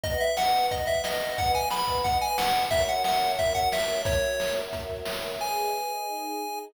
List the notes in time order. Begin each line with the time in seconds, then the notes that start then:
0.03 B4 D#5 F#5, kick, closed hi-hat
0.20 E5, closed hi-hat
0.37 F#5, snare
0.53 closed hi-hat
0.71 D#5, kick, closed hi-hat
0.86 E5, kick, closed hi-hat
1.04 D#5, snare
1.21 closed hi-hat
1.38 F#5, kick, closed hi-hat
1.54 G#5, kick, closed hi-hat
1.70 B5, snare
1.87 kick, closed hi-hat
2.04 F#5, kick, closed hi-hat
2.21 G#5, closed hi-hat
2.38 F#5, snare
2.55 closed hi-hat
2.71 F#4 A#4 C#5 E5, kick, closed hi-hat
2.88 F#5, closed hi-hat
3.04 F#5, snare
3.22 closed hi-hat
3.39 E5, kick, closed hi-hat
3.55 F#5, kick, closed hi-hat
3.72 E5, snare
3.88 closed hi-hat
4.05 C#5, kick, closed hi-hat
4.23 closed hi-hat
4.40 snare
4.56 closed hi-hat
4.73 kick, closed hi-hat
4.89 kick, closed hi-hat
5.05 snare
5.23 closed hi-hat
5.40 G#4 B4 D#5 G#5
6.07 D#4 G#4 D#5